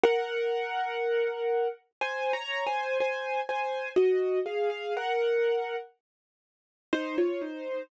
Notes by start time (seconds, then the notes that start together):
0.03 A#4 F#5
2.01 C5 G#5
2.33 C#5 A#5
2.67 C5 G#5
3.00 C5 G#5
3.49 C5 G#5
3.96 F#4 D#5
4.46 G#4 F5
4.70 G#4 F5
4.97 A#4 F#5
6.93 D#4 C5
7.18 F4 C#5
7.42 D#4 C5